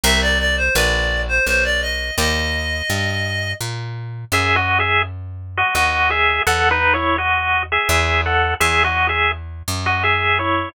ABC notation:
X:1
M:3/4
L:1/16
Q:1/4=84
K:Fdor
V:1 name="Clarinet"
=e d d c d3 c c d _e2 | e8 z4 | [K:F#dor] z12 | z12 |
z12 |]
V:2 name="Lead 1 (square)"
z12 | z12 | [K:F#dor] (3[Ge]2 [Fd]2 [Ge]2 z3 [Fd] [Fd]2 [Ge]2 | (3[Af]2 [DB]2 [Ec]2 [Fd]3 [Ge] [Ge]2 [Af]2 |
(3[Ge]2 [Fd]2 [Ge]2 z3 [Fd] [Ge]2 [Ec]2 |]
V:3 name="Acoustic Guitar (steel)"
[Bc=eg]4 [B_cda]8 | [Bdeg]12 | [K:F#dor] z12 | z12 |
z12 |]
V:4 name="Electric Bass (finger)" clef=bass
C,,4 B,,,4 _C,,4 | E,,4 G,,4 B,,4 | [K:F#dor] F,,8 D,,4 | E,,8 E,,4 |
E,,6 F,,6 |]